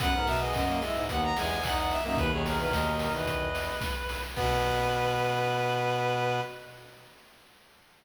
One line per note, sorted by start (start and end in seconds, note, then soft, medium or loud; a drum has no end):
0.00 0.13 F#2 medium
0.00 0.38 B3 medium
0.00 0.13 B4 loud
0.00 0.27 F#5 loud
0.00 kick loud
0.00 closed hi-hat loud
0.13 0.27 G#2 medium
0.13 0.38 A#4 medium
0.27 0.53 B2 medium
0.27 0.40 E5 loud
0.27 open hi-hat loud
0.40 0.64 B3 medium
0.40 0.54 G#4 medium
0.40 0.53 D#5 loud
0.53 0.80 F#2 medium
0.53 0.77 F#4 medium
0.53 1.02 D#5 loud
0.53 kick loud
0.53 clap loud
0.69 0.82 A#3 medium
0.81 1.06 G#3 medium
0.81 1.04 E4 loud
0.81 open hi-hat loud
0.94 1.07 G#2 medium
1.09 1.32 D#2 medium
1.09 1.60 B3 medium
1.09 1.32 B3 medium
1.09 1.22 F#5 loud
1.09 kick loud
1.09 closed hi-hat loud
1.24 1.37 A#5 loud
1.37 1.96 E2 medium
1.37 1.59 G#3 medium
1.37 1.64 G#5 loud
1.37 open hi-hat loud
1.63 1.98 D#4 medium
1.63 1.77 F#5 loud
1.63 kick loud
1.63 clap loud
1.78 1.91 F#5 loud
1.90 2.03 E5 loud
1.90 open hi-hat loud
2.04 2.18 F#2 medium
2.04 2.17 A#3 medium
2.04 2.17 D#4 medium
2.04 2.18 E5 loud
2.17 2.30 D#2 medium
2.17 3.49 B2 medium
2.17 3.49 D#3 medium
2.17 2.30 B4 loud
2.17 2.31 B4 loud
2.17 kick loud
2.17 closed hi-hat loud
2.31 2.58 D#2 medium
2.31 2.44 G#4 loud
2.31 2.45 C#5 medium
2.46 2.59 G#4 loud
2.46 2.59 A#4 medium
2.46 open hi-hat loud
2.59 2.72 E2 medium
2.59 2.93 A#4 loud
2.59 2.72 B4 loud
2.72 3.09 D#2 medium
2.72 3.78 D#5 medium
2.72 kick medium
2.72 snare loud
2.99 3.13 A#4 medium
2.99 open hi-hat loud
3.13 3.70 E2 medium
3.13 4.21 B4 medium
3.27 kick medium
3.27 closed hi-hat loud
3.55 open hi-hat loud
3.81 kick loud
3.81 snare loud
4.09 open hi-hat loud
4.36 6.40 B2 loud
4.36 6.40 B3 loud
4.36 6.40 B4 loud
4.36 kick loud
4.36 crash loud